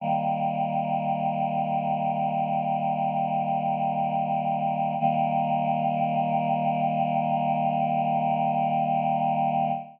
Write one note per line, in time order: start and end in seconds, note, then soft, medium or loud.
0.00 4.95 D#3 medium
0.00 4.95 G3 medium
0.00 4.95 A#3 medium
5.00 9.71 D#3 loud
5.00 9.71 G3 medium
5.00 9.71 A#3 loud